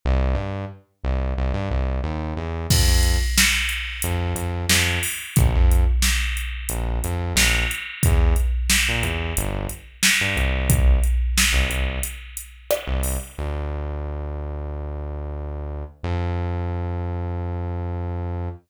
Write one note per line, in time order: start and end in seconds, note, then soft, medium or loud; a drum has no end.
0.05 0.35 C2 loud
0.35 0.65 G2 medium
1.04 1.34 C2 medium
1.37 1.52 C2 medium
1.54 1.69 G2 medium
1.70 2.00 C2 medium
2.04 2.34 D#2 medium
2.36 2.66 E2 medium
2.70 2.86 F2 medium
2.70 kick medium
2.70 crash medium
2.87 3.17 F2 medium
3.03 closed hi-hat medium
3.38 snare loud
3.69 closed hi-hat medium
4.02 4.34 F2 medium
4.02 closed hi-hat medium
4.35 4.65 F2 medium
4.35 closed hi-hat medium
4.69 4.99 F2 medium
4.69 snare medium
5.03 open hi-hat medium
5.36 5.53 A#1 medium
5.36 kick loud
5.36 closed hi-hat medium
5.55 5.85 F2 medium
5.71 closed hi-hat medium
6.02 snare medium
6.37 closed hi-hat medium
6.69 6.99 A#1 medium
6.69 closed hi-hat medium
7.04 7.34 F2 medium
7.04 closed hi-hat medium
7.35 7.65 A#1 medium
7.35 snare medium
7.71 closed hi-hat medium
8.03 8.35 E2 loud
8.03 kick medium
8.03 closed hi-hat medium
8.36 closed hi-hat medium
8.70 snare medium
8.89 9.04 A#2 medium
9.03 9.33 E2 medium
9.03 closed hi-hat medium
9.37 9.67 G1 loud
9.37 closed hi-hat medium
9.69 closed hi-hat medium
10.03 snare loud
10.21 10.36 G2 medium
10.36 10.99 C2 medium
10.36 closed hi-hat soft
10.70 kick medium
10.70 closed hi-hat medium
11.03 closed hi-hat medium
11.38 snare medium
11.53 11.68 C2 medium
11.69 11.99 C2 medium
11.69 closed hi-hat medium
12.03 closed hi-hat medium
12.37 closed hi-hat medium
12.71 cross-stick medium
12.87 13.17 C2 medium
13.03 open hi-hat medium
13.38 15.84 D2 medium
16.03 18.49 F2 medium